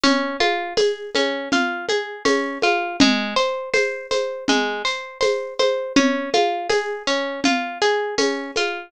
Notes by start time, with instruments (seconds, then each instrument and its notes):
0.04 orchestral harp C#4, low conga, shaker
0.40 orchestral harp F4, high conga, shaker
0.77 orchestral harp G#4, tambourine, high conga, shaker
1.15 orchestral harp C#4, high conga, shaker
1.52 orchestral harp F4, low conga, shaker
1.89 orchestral harp G#4, high conga, shaker
2.25 orchestral harp C#4, tambourine, high conga, shaker
2.62 orchestral harp F4, high conga, shaker
3.00 orchestral harp G#3, low conga, shaker
3.36 orchestral harp C5, shaker
3.74 orchestral harp C5, tambourine, high conga, shaker
4.11 orchestral harp C5, high conga, shaker
4.48 orchestral harp G#3, low conga, shaker
4.85 orchestral harp C5, shaker
5.21 orchestral harp C5, tambourine, high conga, shaker
5.59 orchestral harp C5, high conga, shaker
5.96 orchestral harp C#4, low conga, shaker
6.33 orchestral harp F4, high conga, shaker
6.70 orchestral harp G#4, tambourine, high conga, shaker
7.07 orchestral harp C#4, shaker
7.44 orchestral harp F4, low conga, shaker
7.81 orchestral harp G#4, shaker
8.18 orchestral harp C#4, tambourine, high conga, shaker
8.56 orchestral harp F4, high conga, shaker